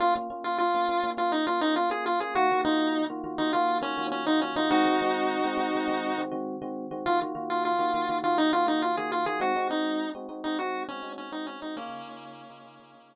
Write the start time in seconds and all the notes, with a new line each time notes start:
0.00 A#3 C#4 F4
0.16 A#3 C#4 F4
0.30 A#3 C#4 F4
0.44 F4
0.58 F4
0.74 A#3 C#4 F4
0.89 A#3 C#4 F4
1.03 A#3 C#4 F4
1.17 A#3 C#4 F4
1.32 D#4
1.47 A#3 C#4 F4
1.61 A#3 C#4 D#4 F4
1.76 F4
1.90 A#3 C#4 F4 G#4
2.06 F4
2.20 A#3 C#4 F4 G#4
2.35 D#3 A#3 F4 F#4
2.51 D#3 A#3 F4 F#4
2.65 D#3 A#3 D#4 F4 F#4
3.10 D#3 A#3 F4 F#4
3.24 D#3 A#3 F4 F#4
3.38 D#3 A#3 D#4 F4 F#4
3.53 D#3 A#3 F4 F#4
3.81 D#3 A#3 C#4 F4 F#4
3.97 D#3 A#3 F4 F#4
4.12 C#4
4.26 D#3 A#3 D#4 F4 F#4
4.41 C#4
4.56 D#3 A#3 D#4 F4 F#4
4.71 D#3 G#3 C4 D#4 F#4
4.85 D#3 G#3 C4 F#4
5.01 D#3 G#3 C4 F#4
5.44 D#3 G#3 C4 F#4
5.57 D#3 G#3 C4 F#4
5.75 D#3 G#3 C4 F#4
5.88 D#3 G#3 C4 F#4
6.18 D#3 G#3 C4 F#4
6.31 D#3 G#3 C4 F#4
6.62 D#3 G#3 C4 F#4
6.91 D#3 G#3 C4 F#4
7.06 D#3 A#3 F4 F#4
7.22 D#3 A#3 F4 F#4
7.35 D#3 A#3 F4 F#4
7.50 F4
7.65 F4
7.79 D#3 A#3 F4 F#4
7.94 D#3 A#3 F4 F#4
8.09 D#3 A#3 F4 F#4
8.24 D#3 A#3 F4 F#4
8.38 D#4
8.53 D#3 A#3 F4 F#4
8.67 D#3 A#3 D#4 F4 F#4
8.82 F4
8.97 D#3 A#3 F4 F#4 G#4
9.12 F4
9.26 D#3 A#3 F4 F#4 G#4
9.40 G#3 C4 D#4 F#4
9.56 G#3 C4 D#4 F#4
9.70 G#3 C4 D#4 F#4
10.15 G#3 C4 D#4 F#4
10.29 G#3 C4 D#4 F#4
10.44 G#3 C4 D#4 F#4
10.59 G#3 C4 D#4 F#4
10.88 G#3 C4 C#4 D#4 F#4
11.03 G#3 C4 D#4 F#4
11.18 C#4
11.32 G#3 C4 D#4 F#4
11.47 C#4
11.62 G#3 C4 D#4 F#4
11.77 C#3 A#3 C#4 D#4 F4 G#4
11.90 C#3 D#4 F4 G#4
12.07 C#3 D#4 F4 G#4
12.50 C#3 D#4 F4 G#4
12.65 C#3 D#4 F4 G#4
12.80 C#3 D#4 F4 G#4
12.94 C#3 D#4 F4 G#4